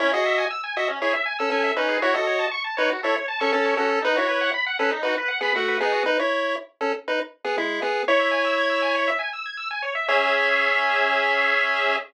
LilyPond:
<<
  \new Staff \with { instrumentName = "Lead 1 (square)" } { \time 4/4 \key cis \minor \tempo 4 = 119 <e' cis''>16 <fis' dis''>8. r8 <fis' dis''>16 r16 <e' cis''>16 r8 <cis' a'>16 <cis' a'>8 <dis' b'>8 | <e' cis''>16 <fis' dis''>8. r8 <dis' b'>16 r16 <e' cis''>16 r8 <cis' a'>16 <cis' a'>8 <cis' a'>8 | <dis' b'>16 <e' cis''>8. r8 <cis' a'>16 r16 <dis' b'>16 r8 <b gis'>16 <a fis'>8 <b gis'>8 | <dis' b'>16 <e' cis''>8. r8 <cis' a'>16 r16 <dis' b'>16 r8 <b gis'>16 <gis e'>8 <b gis'>8 |
<e' cis''>2~ <e' cis''>8 r4. | cis''1 | }
  \new Staff \with { instrumentName = "Lead 1 (square)" } { \time 4/4 \key cis \minor cis'16 gis'16 e''16 gis''16 e'''16 gis''16 e''16 cis'16 gis'16 e''16 gis''16 e'''16 gis''16 e''16 cis'16 gis'16 | fis'16 a'16 cis''16 a''16 cis'''16 a''16 cis''16 fis'16 a'16 cis''16 a''16 cis'''16 a''16 cis''16 fis'16 a'16 | dis'16 fis'16 b'16 fis''16 b''16 fis''16 b'16 dis'16 fis'16 b'16 fis''16 b''16 fis''16 b'16 dis'16 fis'16 | r1 |
cis''16 e''16 gis''16 e'''16 gis'''16 e'''16 gis''16 cis''16 e''16 gis''16 e'''16 gis'''16 e'''16 gis''16 cis''16 e''16 | <cis' gis' e''>1 | }
>>